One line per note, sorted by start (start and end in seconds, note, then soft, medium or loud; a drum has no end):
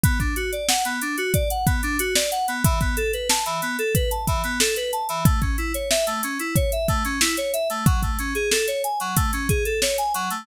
0.04 0.18 B3 medium
0.04 kick loud
0.04 closed hi-hat loud
0.20 0.34 D4 medium
0.20 kick medium
0.20 closed hi-hat medium
0.36 0.51 F#4 medium
0.36 closed hi-hat medium
0.52 0.67 D5 medium
0.52 closed hi-hat medium
0.68 0.83 F#5 medium
0.68 snare loud
0.85 1.00 B3 medium
0.85 closed hi-hat medium
1.01 1.16 D4 medium
1.01 closed hi-hat medium
1.18 1.32 F#4 medium
1.18 closed hi-hat medium
1.34 1.49 D5 medium
1.34 kick medium
1.34 closed hi-hat medium
1.50 1.65 F#5 medium
1.50 closed hi-hat medium
1.66 1.81 B3 medium
1.66 kick medium
1.66 closed hi-hat medium
1.83 1.98 D4 medium
1.83 closed hi-hat medium
1.99 2.14 F#4 medium
1.99 closed hi-hat loud
2.15 2.30 D5 medium
2.15 snare loud
2.32 2.46 F#5 medium
2.32 closed hi-hat medium
2.48 2.63 B3 medium
2.48 closed hi-hat medium
2.64 2.79 E3 medium
2.64 kick loud
2.64 closed hi-hat loud
2.81 2.96 B3 medium
2.81 kick medium
2.81 closed hi-hat medium
2.97 3.11 A4 medium
2.97 closed hi-hat medium
3.13 3.28 B4 medium
3.13 closed hi-hat medium
3.29 3.44 A5 medium
3.29 snare loud
3.46 3.60 E3 medium
3.46 closed hi-hat medium
3.62 3.77 B3 medium
3.62 closed hi-hat medium
3.79 3.93 A4 medium
3.79 closed hi-hat medium
3.95 4.10 B4 medium
3.95 kick medium
3.95 closed hi-hat medium
4.11 4.26 A5 medium
4.11 closed hi-hat medium
4.27 4.42 E3 medium
4.27 kick medium
4.27 closed hi-hat medium
4.44 4.59 B3 medium
4.44 closed hi-hat medium
4.60 4.75 A4 medium
4.60 snare loud
4.76 4.91 B4 medium
4.76 closed hi-hat medium
4.93 5.07 A5 medium
4.93 closed hi-hat medium
5.09 5.24 E3 medium
5.09 closed hi-hat medium
5.25 5.40 A3 medium
5.25 kick loud
5.25 closed hi-hat medium
5.42 5.56 C#4 medium
5.42 kick medium
5.42 closed hi-hat medium
5.58 5.73 E4 medium
5.58 closed hi-hat medium
5.74 5.89 C#5 medium
5.74 closed hi-hat medium
5.90 6.05 E5 medium
5.90 snare loud
6.07 6.21 A3 medium
6.07 closed hi-hat medium
6.23 6.38 C#4 medium
6.23 closed hi-hat medium
6.39 6.54 E4 medium
6.39 closed hi-hat medium
6.56 6.71 C#5 medium
6.56 kick medium
6.56 closed hi-hat medium
6.72 6.87 E5 medium
6.72 closed hi-hat medium
6.88 7.03 A3 medium
6.88 kick medium
6.88 closed hi-hat medium
7.05 7.19 C#4 medium
7.05 closed hi-hat medium
7.21 7.36 E4 medium
7.21 snare loud
7.37 7.52 C#5 medium
7.37 closed hi-hat medium
7.53 7.68 E5 medium
7.53 closed hi-hat medium
7.70 7.85 A3 medium
7.70 closed hi-hat medium
7.86 8.01 F#3 medium
7.86 kick loud
7.86 closed hi-hat medium
8.02 8.17 A3 medium
8.02 kick medium
8.02 closed hi-hat medium
8.19 8.34 C#4 medium
8.19 closed hi-hat medium
8.35 8.50 G#4 medium
8.35 closed hi-hat medium
8.51 8.66 A4 medium
8.51 snare loud
8.68 8.82 C#5 medium
8.68 closed hi-hat medium
8.84 8.99 G#5 medium
8.84 closed hi-hat medium
9.00 9.15 F#3 medium
9.00 closed hi-hat medium
9.16 9.31 A3 medium
9.16 kick medium
9.16 closed hi-hat loud
9.33 9.48 C#4 medium
9.33 closed hi-hat medium
9.49 9.64 G#4 medium
9.49 kick medium
9.49 closed hi-hat medium
9.65 9.80 A4 medium
9.65 closed hi-hat medium
9.82 9.97 C#5 medium
9.82 snare loud
9.98 10.13 G#5 medium
9.98 closed hi-hat medium
10.14 10.29 F#3 medium
10.14 closed hi-hat medium
10.30 10.45 A3 medium
10.30 closed hi-hat medium